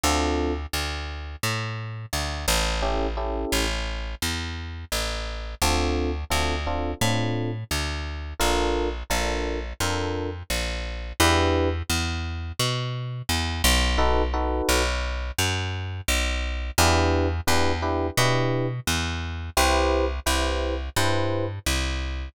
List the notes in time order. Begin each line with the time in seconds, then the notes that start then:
0.03 D2 C4 D4 F4 A4
0.73 D2
1.43 A2
2.13 D2
2.48 A1
2.82 C#4 E4 G4 A4
3.17 C#4 E4 G4 A4
3.52 A1
4.22 E2
4.92 A1
5.62 D2 C4 D4 F4 A4
6.30 D2 C4 D4 F4 A4
6.67 C4 D4 F4 A4
7.01 A2 C4 D4 F4 A4
7.71 D2
8.40 A#1 D4 F4 A4 A#4
9.10 A#1 D4 F4 A4 A#4
9.80 F2 D4 F4 A4 A#4
10.50 A#1
11.20 E2 D4 E4 G4 B4
11.90 E2
12.59 B2
13.29 E2
13.64 B1
13.98 D#4 F#4 A4 B4
14.34 D#4 F#4 A4 B4
14.69 B1
15.38 F#2
16.08 B1
16.78 E2 D4 E4 G4 B4
17.47 E2 D4 E4 G4 B4
17.82 D4 E4 G4 B4
18.17 B2 D4 E4 G4 B4
18.87 E2
19.57 C2 E4 G4 B4 C5
20.26 C2 E4 G4 B4 C5
20.96 G2 E4 G4 B4 C5
21.66 C2